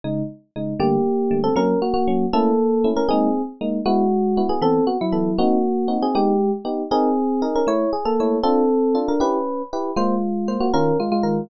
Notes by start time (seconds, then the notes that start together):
0.04 C#3 G#3 D#4
0.56 C#3 G#3 D#4
0.80 D3 G3 A3 A#3 G4
1.31 D3 G3 A3
1.44 C4 A4
1.56 F#3 A#3 C#4 A#4
1.82 A#3 F#4
1.94 A#3 F#4
2.08 F#3 A#3 C#4
2.33 A3 A#3 C#4 E4 A4
2.84 A3 C#4 E4
2.96 C#4 A#4
3.09 G#3 A#3 C4 D#4 G#4
3.61 G#3 A#3 D#4
3.86 G#3 B3 E4 F#4
4.37 B3 E4 F#4
4.49 B3 G#4
4.62 E3 B3 C4 A4
4.87 B3 F#4
5.01 F#3 E4
5.12 E3 B3 A4
5.38 A#3 C4 D#4 F#4
5.88 C4 D#4 F#4
6.02 C4 G#4
6.15 G#3 B3 D#4 G4
6.65 B3 D#4 G4
6.91 C4 D#4 G#4 A#4
7.42 D#4 G#4 A#4
7.56 C#4 A#4
7.67 A3 E4 C#5
7.93 G#4
8.05 A#3 A4
8.20 A3 E4 C#5
8.43 C4 D4 F4 A4
8.95 D4 F4 A4
9.08 D4 A#4
9.20 C#4 E4 G4 B4
9.73 E4 G4 B4
9.96 G#3 A#3 F4 C5
10.48 A#3 F4 C5
10.60 A#3 F#4
10.74 D#3 C#4 F4 A#4
11.00 G#3 F4
11.12 G#3 F4
11.23 D#3 F4 A#4